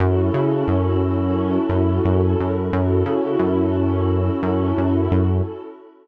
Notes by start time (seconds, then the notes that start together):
0.00 F#2 C#4 E4 F#4 A4
0.34 C#3
0.68 F#2
1.69 F#2
2.05 F#2
2.40 F#2
2.72 F#2 C#4 E4 F#4 A4
3.06 C#3
3.39 F#2
4.42 F#2
4.78 F#2
5.12 F#2